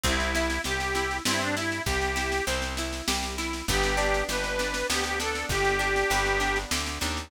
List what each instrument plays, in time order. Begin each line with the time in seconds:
0.04 electric bass (finger) C2, acoustic guitar (steel) C4, accordion E4, kick, snare
0.20 snare
0.35 acoustic guitar (steel) E4, snare
0.50 snare
0.64 electric bass (finger) C2, accordion G4, acoustic guitar (steel) G4, snare
0.80 snare
0.95 acoustic guitar (steel) E4, snare
1.11 snare
1.25 electric bass (finger) G2, acoustic guitar (steel) C4, accordion E4, snare
1.41 accordion D4, snare
1.57 accordion E4, acoustic guitar (steel) E4, snare
1.72 snare
1.86 electric bass (finger) C2, acoustic guitar (steel) G4, accordion G4, kick, snare
2.02 snare
2.16 acoustic guitar (steel) E4, snare
2.32 snare
2.47 electric bass (finger) C2, acoustic guitar (steel) C4, snare
2.62 snare
2.77 acoustic guitar (steel) E4, snare
2.93 snare
3.08 electric bass (finger) C2, acoustic guitar (steel) G4, snare
3.23 snare
3.38 acoustic guitar (steel) E4, snare
3.53 snare
3.68 electric bass (finger) G1, acoustic guitar (steel) B3, accordion G4, kick, snare
3.83 snare
3.97 acoustic guitar (steel) D4, snare
4.14 snare
4.29 electric bass (finger) G1, acoustic guitar (steel) G4, accordion B4, snare
4.44 snare
4.59 acoustic guitar (steel) D4, snare
4.74 snare
4.90 electric bass (finger) D2, acoustic guitar (steel) B3, accordion G4, snare
5.04 accordion G4, snare
5.19 acoustic guitar (steel) D4, accordion A4, snare
5.35 snare
5.49 electric bass (finger) G1, accordion G4, acoustic guitar (steel) G4, kick, snare
5.65 snare
5.79 acoustic guitar (steel) D4, snare
5.96 snare
6.10 electric bass (finger) G1, acoustic guitar (steel) B3, snare
6.26 snare
6.40 acoustic guitar (steel) D4, snare
6.56 snare
6.71 electric bass (finger) D2, acoustic guitar (steel) G4, snare
6.86 snare
7.01 electric bass (finger) D#2, acoustic guitar (steel) D4, snare
7.17 snare